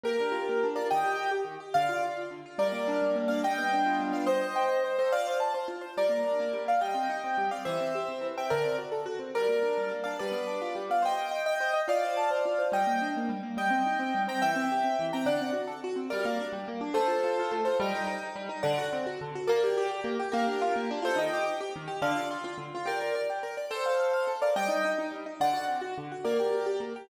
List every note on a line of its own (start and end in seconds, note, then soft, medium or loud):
0.04 0.16 A#3 medium
0.04 0.67 G4 medium
0.04 0.67 A#4 medium
0.20 0.33 D4 medium
0.32 0.45 F4 medium
0.49 0.62 A#3 medium
0.63 0.76 D4 medium
0.76 0.88 F4 medium
0.76 0.87 A#4 medium
0.76 0.87 D5 medium
0.90 1.04 D#3 medium
0.90 1.30 D#5 medium
0.90 1.30 G5 medium
1.04 1.16 G4 medium
1.16 1.29 G4 medium
1.31 1.44 G4 medium
1.45 1.57 D#3 medium
1.60 1.73 G4 medium
1.74 1.88 D3 medium
1.74 2.01 D5 medium
1.74 2.01 F5 medium
1.89 2.01 F4 medium
2.03 2.15 F4 medium
2.16 2.29 F4 medium
2.31 2.43 D3 medium
2.46 2.58 F4 medium
2.58 3.01 G3 medium
2.58 3.16 A#4 medium
2.58 3.16 D5 medium
2.72 3.15 A#3 medium
2.88 3.28 D4 medium
3.02 3.42 G3 medium
3.15 3.42 A#3 medium
3.28 3.42 D4 medium
3.28 3.41 D5 medium
3.28 3.41 F5 medium
3.43 3.99 G3 medium
3.43 4.03 D#5 medium
3.43 4.03 G5 medium
3.58 4.11 B3 medium
3.73 4.26 D4 medium
3.86 4.26 F4 medium
4.00 4.26 G3 medium
4.12 4.25 B3 medium
4.12 4.25 D5 medium
4.12 4.25 F5 medium
4.26 4.84 C5 medium
4.26 4.84 D#5 medium
4.41 4.54 D#5 medium
4.56 4.68 G5 medium
4.69 4.82 D#5 medium
4.84 4.97 C5 medium
4.99 5.12 A4 medium
4.99 5.12 C5 medium
4.99 5.12 D#5 medium
5.12 5.26 F4 medium
5.12 5.37 D5 medium
5.12 5.37 F5 medium
5.27 5.40 C5 medium
5.40 5.53 A5 medium
5.54 5.67 C5 medium
5.68 5.81 F4 medium
5.81 5.94 C5 medium
5.97 6.10 G3 medium
5.97 6.62 A#4 medium
5.97 6.62 D5 medium
6.09 6.22 A#3 medium
6.25 6.37 D4 medium
6.40 6.52 A#3 medium
6.53 6.66 G3 medium
6.65 6.78 A#3 medium
6.65 6.80 D5 medium
6.65 6.80 F5 medium
6.81 6.94 G3 medium
6.81 7.49 D#5 medium
6.81 7.49 G5 medium
6.94 7.07 C4 medium
7.10 7.22 D#4 medium
7.24 7.37 C4 medium
7.38 7.50 G3 medium
7.51 7.65 C4 medium
7.51 7.63 D5 medium
7.51 7.63 F5 medium
7.65 7.79 E3 medium
7.65 8.27 C5 medium
7.65 8.27 E5 medium
7.81 7.93 C4 medium
7.95 8.08 G4 medium
8.09 8.21 C4 medium
8.21 8.34 E3 medium
8.37 8.50 C4 medium
8.37 8.51 E5 medium
8.37 8.51 G5 medium
8.50 8.64 D3 medium
8.50 8.76 A#4 medium
8.50 8.76 D5 medium
8.65 8.77 C4 medium
8.78 8.91 F#4 medium
8.92 9.04 A4 medium
9.06 9.18 F#4 medium
9.19 9.32 C4 medium
9.35 9.49 G3 medium
9.35 9.92 A#4 medium
9.35 9.92 D5 medium
9.49 9.63 A#3 medium
9.63 9.77 D4 medium
9.78 9.92 G3 medium
9.91 10.06 A#3 medium
10.04 10.19 D4 medium
10.04 10.16 D5 medium
10.04 10.16 F5 medium
10.19 10.35 G3 medium
10.19 10.83 B4 medium
10.19 10.83 D5 medium
10.32 10.46 B3 medium
10.47 10.61 D4 medium
10.61 10.76 F4 medium
10.75 10.89 G3 medium
10.90 11.03 B3 medium
10.90 11.02 D5 medium
10.90 11.02 F5 medium
11.02 11.15 C5 medium
11.02 11.46 D#5 medium
11.02 11.46 G5 medium
11.17 11.30 D#5 medium
11.31 11.44 G5 medium
11.46 11.80 D#5 medium
11.46 11.80 G5 medium
11.60 11.73 C5 medium
11.73 11.86 D#5 medium
11.88 12.00 F4 medium
11.88 12.67 D5 medium
11.88 12.67 F5 medium
12.03 12.15 C5 medium
12.17 12.29 A5 medium
12.31 12.43 C5 medium
12.45 12.58 F4 medium
12.59 12.71 C5 medium
12.72 12.85 G3 medium
12.72 13.08 D#5 medium
12.72 13.08 G5 medium
12.87 12.99 A#3 medium
13.01 13.14 D4 medium
13.17 13.30 A#3 medium
13.29 13.42 G3 medium
13.43 13.56 A#3 medium
13.57 13.70 G3 medium
13.57 14.22 D#5 medium
13.57 14.22 G5 medium
13.70 13.83 C4 medium
13.86 13.99 D#4 medium
13.99 14.12 C4 medium
14.15 14.27 G3 medium
14.28 14.40 C4 medium
14.28 14.40 G5 medium
14.28 14.40 A#5 medium
14.42 14.55 E3 medium
14.42 15.06 E5 medium
14.42 15.06 G5 medium
14.56 14.68 C4 medium
14.72 14.84 G4 medium
14.84 14.97 C4 medium
14.99 15.12 E3 medium
15.13 15.26 C4 medium
15.13 15.26 G5 medium
15.13 15.26 A#5 medium
15.26 15.38 D3 medium
15.26 15.50 D5 medium
15.26 15.50 F#5 medium
15.41 15.54 C4 medium
15.53 15.66 F#4 medium
15.67 15.80 A4 medium
15.84 15.97 F#4 medium
15.96 16.09 C4 medium
16.10 16.25 G3 loud
16.10 16.45 A#4 medium
16.10 16.45 D5 medium
16.25 16.38 A#3 medium
16.40 16.52 D4 medium
16.53 16.65 G3 medium
16.68 16.81 A#3 medium
16.81 16.94 D4 medium
16.94 17.07 A3 loud
16.94 17.53 A4 medium
16.94 17.53 C5 medium
17.08 17.20 F4 medium
17.24 17.37 F4 medium
17.39 17.52 F4 medium
17.52 17.64 A3 loud
17.65 17.80 F4 medium
17.65 17.77 A4 medium
17.65 17.77 C5 medium
17.80 17.92 G3 loud
17.80 18.23 D#5 medium
17.80 18.23 G5 medium
17.95 18.06 D#4 loud
18.07 18.20 D#4 medium
18.23 18.36 D#4 medium
18.36 18.48 G3 loud
18.49 18.62 D#4 medium
18.63 18.76 D3 loud
18.63 18.85 D5 medium
18.63 18.85 F#5 medium
18.78 18.90 F#4 medium
18.93 19.05 C4 medium
19.07 19.19 F#4 medium
19.21 19.34 D3 medium
19.35 19.48 F#4 medium
19.47 19.62 A#3 loud
19.47 19.86 A#4 medium
19.47 19.86 D5 medium
19.63 19.76 G4 loud
19.77 19.90 G4 loud
19.91 20.04 G4 medium
20.04 20.17 A#3 loud
20.20 20.32 G4 medium
20.32 20.46 A#3 loud
20.32 20.90 G4 medium
20.32 20.90 A#4 medium
20.47 20.60 D4 medium
20.62 20.74 F4 loud
20.76 20.89 A#3 medium
20.91 21.03 D4 loud
21.02 21.15 F4 loud
21.02 21.18 A4 medium
21.02 21.18 C5 medium
21.16 21.29 D#3 loud
21.16 21.60 D#5 medium
21.16 21.60 G5 medium
21.33 21.45 G4 loud
21.46 21.58 G4 medium
21.61 21.73 G4 loud
21.76 21.88 D#3 medium
21.88 22.00 G4 medium
22.02 22.14 D3 loud
22.02 22.28 D5 medium
22.02 22.28 F5 medium
22.16 22.28 F4 medium
22.31 22.43 F4 loud
22.44 22.57 F4 loud
22.58 22.70 D3 medium
22.75 22.87 F4 loud
22.86 22.98 G4 medium
22.86 23.21 A#4 medium
22.86 23.21 D5 medium
23.02 23.14 A#4 medium
23.15 23.28 D5 medium
23.30 23.42 G4 medium
23.43 23.56 A#4 medium
23.57 23.70 D5 medium
23.71 24.32 A4 medium
23.71 24.32 C5 medium
23.86 23.98 F5 medium
24.00 24.12 F5 medium
24.13 24.26 F5 medium
24.27 24.40 A4 medium
24.42 24.55 A#4 medium
24.42 24.55 D5 medium
24.42 24.55 F5 medium
24.56 24.69 G3 medium
24.56 24.90 D#5 medium
24.56 24.90 G5 loud
24.68 24.81 D#4 medium
24.85 24.97 D#4 medium
24.98 25.11 D#4 medium
25.12 25.24 G3 medium
25.26 25.39 D#4 medium
25.40 25.53 D3 loud
25.40 25.64 D5 medium
25.40 25.64 F#5 medium
25.53 25.66 F#4 medium
25.67 25.80 C4 medium
25.81 25.94 F#4 medium
25.98 26.10 D3 medium
26.12 26.24 F#4 medium
26.25 26.38 A#3 loud
26.25 26.66 A#4 medium
26.25 26.66 D5 medium
26.40 26.52 G4 medium
26.53 26.65 G4 medium
26.66 26.79 G4 medium
26.80 26.93 A#3 medium
26.96 27.09 G4 medium